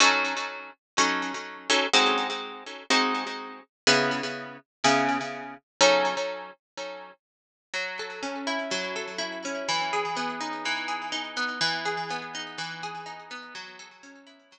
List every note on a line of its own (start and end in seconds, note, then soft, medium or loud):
0.00 0.34 F#3 loud
0.00 0.34 C#4 loud
0.00 0.34 D#4 medium
0.00 0.34 A4 loud
0.98 1.32 F#3 medium
0.98 1.32 C#4 medium
0.98 1.32 D#4 medium
0.98 1.32 A4 medium
1.70 1.87 F#3 medium
1.70 1.87 C#4 medium
1.70 1.87 D#4 medium
1.70 1.87 A4 medium
1.93 2.27 G#3 loud
1.93 2.27 C4 medium
1.93 2.27 D#4 loud
1.93 2.27 F#4 loud
2.90 3.24 G#3 medium
2.90 3.24 C4 medium
2.90 3.24 D#4 medium
2.90 3.24 F#4 medium
3.87 4.21 C#3 medium
3.87 4.21 B3 loud
3.87 4.21 E4 loud
3.87 4.21 G#4 medium
4.84 5.18 C#3 medium
4.84 5.18 B3 medium
4.84 5.18 E4 medium
4.84 5.18 G#4 medium
5.81 6.15 F#3 loud
5.81 6.15 C#4 loud
5.81 6.15 D#4 medium
5.81 6.15 A4 medium
7.74 8.71 F#3 medium
7.99 8.95 A4 medium
8.23 9.44 C#4 medium
8.47 9.18 E4 medium
8.71 9.63 F#3 medium
8.96 9.65 A4 medium
9.18 9.64 E4 medium
9.45 9.68 C#4 medium
9.69 10.65 E3 medium
9.93 10.88 G#4 medium
10.16 11.36 B3 medium
10.41 11.12 D#4 medium
10.65 11.57 E3 medium
10.88 11.57 G#4 medium
11.12 11.58 D#4 medium
11.37 11.60 B3 medium
11.61 12.58 E3 medium
11.85 12.83 G#4 medium
12.10 13.30 B3 medium
12.35 13.05 D#4 medium
12.58 13.50 E3 medium
12.83 13.52 G#4 medium
13.06 13.52 D#4 medium
13.31 13.54 B3 medium
13.55 14.52 F#3 medium
13.79 14.59 A4 medium
14.03 14.59 C#4 medium
14.27 14.59 E4 medium
14.52 14.59 F#3 medium